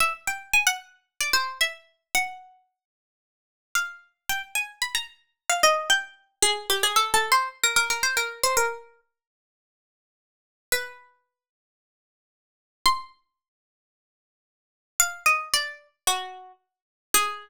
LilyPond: \new Staff { \time 4/4 \key aes \lydian \tempo 4 = 112 e''16 r16 g''8 aes''16 ges''16 r8. d''16 c''8 fes''4 | ges''2. f''4 | g''16 r16 aes''8 ces'''16 bes''16 r8. f''16 ees''8 g''4 | aes'8 g'16 aes'16 \tuplet 3/2 { a'8 a'8 c''8 } r16 bes'16 bes'16 bes'16 c''16 bes'8 c''16 |
bes'4 r2. | ces''2. r4 | c'''2. r4 | f''8 ees''8 d''8. r16 ges'4 r4 |
aes'1 | }